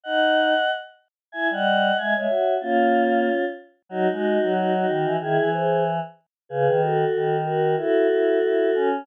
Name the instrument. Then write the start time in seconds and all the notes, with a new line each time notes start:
choir aahs
0.03 D#4 D#5 F#5
1.32 E4 E5 G#5
1.50 G3 D#5 F#5
1.98 G#3 E5 G#5
2.15 G#3 C#5 E5
2.29 F#4
2.61 A#3 C#4 F4
3.89 F#3 D#4 F#4
4.10 G#3 D#4 F#4
4.42 F#3
4.55 D#4 F#4
4.74 D#4 F#4
4.88 D#3
5.05 E3
5.20 D#3 E4 G#4
5.38 E3
5.52 G#4 C5
6.49 C#3 G#4 B4
6.67 D#3
6.81 F#4 A4
7.15 D#3
7.45 F#4 A#4
7.77 E4 F#4 A4
8.10 E4
8.43 E4
8.75 C#4